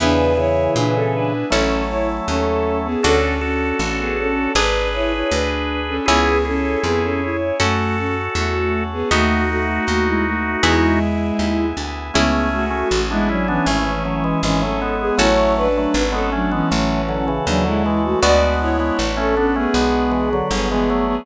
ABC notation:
X:1
M:4/4
L:1/16
Q:1/4=79
K:A
V:1 name="Violin"
[DB]2 [Ec]2 [DB] [CA] [DB]2 [CA]2 [Ec] z [CA]3 [B,G] | [CA]2 [CA]2 [CA] [B,G] [CA]2 [DB]2 [Ec] [Ec] [DB]3 [CA] | [B,G]2 [CA]2 [B,G] [CA] [Ec]2 [A,F]2 [CA] z [A,F]3 [B,G] | [A,F]2 [A,F]2 [A,F] [G,E] [A,F]2 [G,E]6 z2 |
[B,G]2 [A,F]3 [G,E] [F,D] [E,C]5 [E,C] [CA]2 [B,G] | [Ec]2 [DB]3 [CA] [F,D] [E,C]5 [F,D] [G,E]2 [A,F] | [Fd]2 [Ec]3 [CA] [CA] [B,G]5 [B,G] [B,G]2 [B,G] |]
V:2 name="Drawbar Organ"
[C,E,]2 [C,E,]6 [F,A,]8 | [FA]2 [FA]6 [GB]8 | [EG]2 [EG]6 [FA]8 | [^DF]12 z4 |
[A,C]3 [A,C] z [B,D] [CE] [B,D] [A,C]2 [F,A,] [E,G,] [E,G,] [F,A,] [G,B,]2 | [F,A,]3 [F,A,] z [G,B,] [A,C] [G,B,] [F,A,]2 [D,F,] [C,E,] [C,E,] [D,F,] [E,G,]2 | [G,B,]3 [G,B,] z [A,C] [B,D] [A,C] [G,B,]2 [E,G,] [D,F,] [D,F,] [E,G,] [F,A,]2 |]
V:3 name="Harpsichord"
[B,EG]8 [CEA]8 | [DFA]8 [DGB]8 | [CEG]8 [CFA]8 | [B,^DF]8 [B,EG]8 |
[CEG]16 | [CFA]16 | [B,DF]16 |]
V:4 name="Electric Bass (finger)" clef=bass
E,,4 ^A,,4 =A,,,4 ^D,,4 | D,,4 A,,,4 G,,,4 D,,4 | C,,4 =F,,4 ^F,,4 E,,4 | ^D,,4 D,,4 E,,4 D,,2 =D,,2 |
C,,4 A,,,4 G,,,4 G,,,4 | A,,,4 G,,,4 A,,,4 ^D,,4 | D,,4 A,,,4 B,,,4 =G,,,4 |]
V:5 name="Drawbar Organ"
[B,EG]8 [CEA]8 | [DFA]8 [DGB]8 | [CEG]8 [CFA]8 | [B,^DF]8 [B,EG]8 |
[CEG]16 | [CFA]16 | [B,DF]16 |]